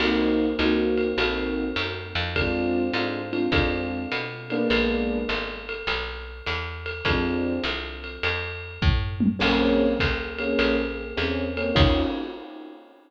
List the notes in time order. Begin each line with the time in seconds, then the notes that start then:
0.00 C2 A#3 C4 D#4 F#4, crash, ride
0.59 C#2 A#3 C4 D#4 F#4, hi-hat pedal, ride
0.98 ride
1.18 A#1 A#3 C4 D#4 F#4, ride
1.76 F#2, hi-hat pedal, ride
2.15 F2, ride
2.36 G#3 C4 D4 F4, kick, ride
2.94 G#2 G#3 C4 D4 F4, hi-hat pedal, ride
3.32 G#3 C4 D4 F4, ride
3.52 F2 G#3 C4 D4 F4, kick, ride
4.12 B2, hi-hat pedal, ride
4.50 G#3 A#3 B3 D4, ride
4.70 A#1, ride
5.29 G#1, hi-hat pedal, ride
5.69 ride
5.87 B1, ride
6.46 E2, hi-hat pedal, ride
6.86 ride
7.05 F2 F3 G#3 C4 D4, kick, ride
7.64 C2, hi-hat pedal, ride
8.04 ride
8.23 F2, ride
8.82 A2, kick, floor tom
9.20 high tom
9.39 A#1 A#3 C4 C#4 G#4, crash, ride
10.00 C#2, kick, hi-hat pedal, ride
10.38 A#3 C4 C#4 G#4, ride
10.59 A#1, ride
11.17 E2 A#3 C4 C#4 G#4, hi-hat pedal, ride
11.57 A#3 C4 C#4 G#4, ride
11.75 D#2 C#4 D#4 F4 F#4, kick, crash